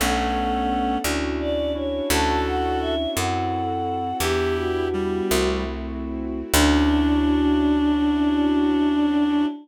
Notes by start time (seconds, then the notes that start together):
0.00 B1 A3 B3 C#4 D4 A4 F#5
1.04 D2 C#4 D4 E4 F#4
1.40 D5
1.75 C#4 D4 E4 F#4 C#5
2.10 D2 C#4 D4 E4 F#4 A4 A5
2.46 F#5
2.81 E5
3.15 F#2 C4 E4 F#4 A4 F#5
4.20 E2 B3 D4 E4 G4
4.57 F#4
4.93 G3
5.30 C2 A3 C4 E4 F#4
6.54 D2 C#4 D4 E4 F#4